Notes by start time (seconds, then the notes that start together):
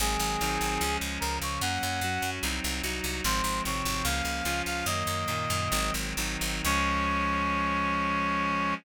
0.00 G#1 D#3 F#3 G#3 C4 G#4
0.20 G#1
0.41 G#1 D#3 F#3 C4 D#4
0.61 G#1
0.81 C#2 F3 G#3 C#4
1.01 C#2
1.20 C#2 C#3 F3 C#4 A#4
1.42 C#2 C#5
1.61 F#2 F#3 A#3 C#4 F#5
1.83 F#2
2.01 F#2 F#3 C#4 F#4
2.22 F#2
2.43 C2 F#3 C4 D#4
2.64 C2
2.83 C2 F#3 D#4 F#4
3.04 C2
3.24 G#1 F3 G#3 C4 C5
3.44 G#1
3.65 G#1 C3 F3 C4 C#5
3.85 G#1
4.04 C#2 F3 A#3 C#4 F5
4.25 C#2
4.45 C#2 F3 C#4 F4
4.66 C#2 F5
4.86 F#2 D#3 F#3 A#3 D#5
5.07 F#2
5.28 F#2 A#2 D#3 A#3
5.50 F#2
5.71 G#1 D#3 F#3 G#3 C4
5.94 G#1
6.17 G#1 D#3 F#3 C4 D#4
6.41 G#1
6.64 C#2 F3 G#3 C#4 C#5